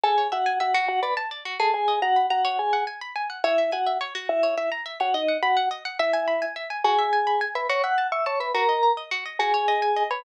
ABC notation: X:1
M:6/8
L:1/8
Q:3/8=141
K:F#m
V:1 name="Vibraphone"
[Gg]2 [Ff]2 [Ff]2 | [Ff] [Bb] z3 [Aa] | [Gg]2 [Ff]2 [Ff]2 | [Gg]2 z4 |
[K:A] [Ee]2 [Ff]2 z2 | [Ee]2 [Ee] z2 [Ff] | [^D^d]2 [Ff]2 z2 | [Ee]4 z2 |
[K:F#m] [Gg]5 [Bb] | [cc'] [ff']2 [ee'] [cc'] [Bb] | [^A^a]3 z3 | [Gg]5 [Bb] |]
V:2 name="Pizzicato Strings"
A c e g e F- | F d a d F G- | G ^d ^a b a c- | c f g b g f |
[K:A] c e g e c F- | F c e ^a e c | ^d f b f d f | e g b g e g |
[K:F#m] F e g b g e | F e a c' a e | F ^d ^a d F d | F c ^d g d c |]